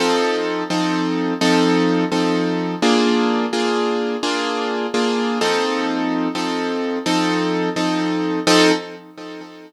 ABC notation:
X:1
M:12/8
L:1/8
Q:3/8=85
K:F
V:1 name="Acoustic Grand Piano"
[F,C_EA]3 [F,CEA]3 [F,CEA]3 [F,CEA]3 | [B,DF_A]3 [B,DFA]3 [B,DFA]3 [B,DFA]2 [F,C_E=A]- | [F,C_EA]3 [F,CEA]3 [F,CEA]3 [F,CEA]3 | [F,C_EA]3 z9 |]